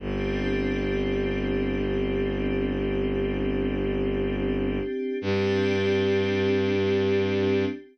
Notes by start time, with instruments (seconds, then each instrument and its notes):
0.00 violin G1, pad 5 (bowed) C4 D4 G4
5.21 violin G2, pad 5 (bowed) C4 D4 G4